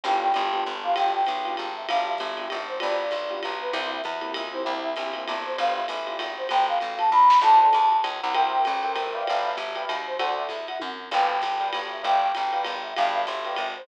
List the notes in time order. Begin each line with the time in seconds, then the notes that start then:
0.04 G1 B3 D4 F4 G4 G5, crash, ride
0.22 G5
0.34 G1 B3 D4 F4 G4, hi-hat pedal, ride
0.52 B3 D4 F4 G4, ride
0.66 G1
0.84 B3 D4 F4 G4 F5
0.96 G1 G5, ride
1.14 G5
1.26 B1, hi-hat pedal, ride
1.45 B3 D4 F4 G4, ride
1.57 G#1, ride
1.76 E5
1.88 G1 B3 D4 F4 G4 F5, ride
2.07 E5
2.18 G1, kick, hi-hat pedal, ride
2.37 B3 D4 F4 G4, ride
2.50 G#1, ride
2.68 C5
2.80 G1 B3 D4 F4 G4 D5, ride
2.99 D5
3.11 B1, kick, hi-hat pedal, ride
3.30 B3 D4 F4 G4, ride
3.43 B1, ride
3.60 B4
3.72 C2 A#3 C4 E4 G4 E5, ride
3.92 E5
4.04 E2, kick, hi-hat pedal, ride
4.21 A#3 C4 E4 G4, ride
4.34 C#2, ride
4.53 A#3 C4 E4 G4 C5
4.64 C2 A#3 C4 E4 G4 E5
4.84 E5
4.96 A#1 A#3 C4 E4 G4, hi-hat pedal, ride
5.13 A#3 C4 E4 G4, ride
5.28 G1, ride
5.45 C5
5.57 G1 B3 D4 F4 G4 F5, ride
5.77 E5
5.88 A1, hi-hat pedal, ride
6.06 B3 D4 F4 G4, ride
6.19 G#1, kick, ride
6.37 C5
6.49 G1 G5, ride
6.68 F5
6.80 A1, hi-hat pedal, ride
6.98 A5, ride
7.11 D#2 B5, kick
7.30 snare
7.41 D2 A4 C5 D5 F#5 A5, crash, ride
7.60 A5
7.73 E2, hi-hat pedal, ride
7.92 ride
8.04 C#2, ride
8.22 C2 F#5
8.34 A#4 C5 E5 G5, ride
8.53 G5
8.65 A1, hi-hat pedal, ride
8.83 A#4 C5 E5 G5, ride
8.95 G1 A#4 C5 E5 G5, ride
9.14 B4 D5 E5 F5 G5
9.26 G1 F5, ride
9.44 E5
9.57 G1, kick, hi-hat pedal, ride
9.76 B4 D5 F5 G5, ride
9.89 D#2, ride
10.07 C5
10.19 D2 A4 C5 D5 F#5, ride
10.38 E5
10.49 E2, kick, hi-hat pedal, ride
10.68 F#5, ride
10.80 F#2, kick, high tom
11.11 G1 B4 D5 F5 G5, crash, ride
11.30 G5
11.42 G1, kick, hi-hat pedal, ride
11.60 B4 D5 F5 G5, ride
11.73 G1, ride
11.92 E5
12.03 G1 B4 D5 F5 G5, kick, ride
12.21 G5
12.35 A1, hi-hat pedal, ride
12.53 B4 D5 F5 G5, ride
12.65 G#1, ride
12.82 E5
12.96 G1 B4 D5 F5 G5, ride
13.14 E5
13.27 G1, hi-hat pedal, ride
13.45 B4 D5 F5 G5, ride
13.56 G#1, kick, ride
13.76 C5